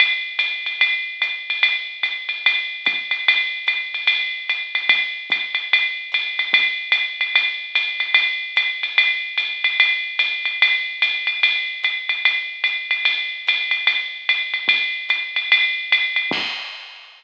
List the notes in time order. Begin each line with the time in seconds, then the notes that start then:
0.00 ride
0.39 hi-hat pedal, ride
0.66 ride
0.81 ride
1.22 hi-hat pedal, ride
1.50 ride
1.63 ride
2.03 hi-hat pedal, ride
2.29 ride
2.46 ride
2.85 kick, hi-hat pedal, ride
3.11 ride
3.28 ride
3.67 hi-hat pedal, ride
3.94 ride
4.07 ride
4.49 hi-hat pedal, ride
4.75 ride
4.89 kick, ride
5.30 kick, hi-hat pedal, ride
5.55 ride
5.73 ride
6.12 hi-hat pedal, ride
6.39 ride
6.53 kick, ride
6.92 hi-hat pedal, ride
7.21 ride
7.35 ride
7.75 hi-hat pedal, ride
8.00 ride
8.14 ride
8.56 hi-hat pedal, ride
8.83 ride
8.98 ride
9.38 hi-hat pedal, ride
9.64 ride
9.80 ride
10.19 hi-hat pedal, ride
10.45 ride
10.62 ride
11.02 hi-hat pedal, ride
11.27 ride
11.43 ride
11.84 hi-hat pedal, ride
12.09 ride
12.25 ride
12.64 hi-hat pedal, ride
12.91 ride
13.05 ride
13.47 hi-hat pedal, ride
13.71 ride
13.87 ride
14.29 hi-hat pedal, ride
14.54 ride
14.68 kick, ride
15.09 hi-hat pedal, ride
15.36 ride
15.52 ride
15.92 hi-hat pedal, ride
16.16 ride
16.31 kick, crash